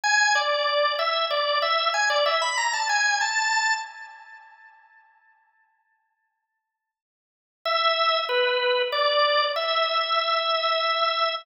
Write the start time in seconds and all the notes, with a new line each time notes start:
0.04 G#5
0.35 D5
0.99 E5
1.30 D5
1.62 E5
1.94 G#5
2.10 D5
2.26 E5
2.42 B5
2.57 A#5
2.73 A5
2.89 G#5
3.21 A5
7.65 E5
8.29 B4
8.92 D5
9.56 E5